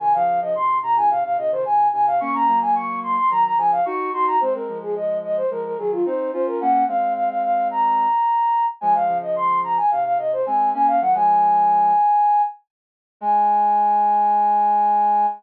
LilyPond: <<
  \new Staff \with { instrumentName = "Flute" } { \time 4/4 \key aes \mixolydian \tempo 4 = 109 aes''16 f''8 ees''16 c'''8 bes''16 aes''16 f''16 f''16 ees''16 c''16 aes''8 aes''16 f''16 | des'''16 bes''8 aes''16 des'''8 c'''16 c'''16 bes''16 bes''16 aes''16 f''16 des'''8 c'''16 bes''16 | c''16 bes'8 aes'16 ees''8 ees''16 c''16 bes'16 bes'16 aes'16 f'16 c''8 c''16 bes'16 | ges''8 f''8 f''16 f''16 f''8 bes''2 |
aes''16 f''8 ees''16 c'''8 bes''16 aes''16 f''16 f''16 ees''16 c''16 aes''8 aes''16 f''16 | ges''16 aes''2~ aes''8. r4 | aes''1 | }
  \new Staff \with { instrumentName = "Ocarina" } { \time 4/4 \key aes \mixolydian <c ees>16 <des f>8 <des f>16 <aes, c>8 <aes, c>16 <bes, des>16 <aes, c>16 <aes, c>16 <bes, des>16 <c ees>16 <aes, c>8 <aes, c>8 | <bes des'>16 <bes des'>16 <ges bes>4. <ees ges>8 <des f>8 <ees' ges'>8 <ees' ges'>8 | <aes c'>16 <aes c'>16 <f aes>4. <f aes>8 <ees ges>8 <c' ees'>8 <des' f'>8 | <bes des'>8 <aes c'>2~ <aes c'>8 r4 |
<f aes>16 <f aes>16 <des f>4. <aes, c>8 <aes, c>8 <aes c'>8 <bes des'>8 | <ees ges>16 <f aes>4.~ <f aes>16 r2 | aes1 | }
>>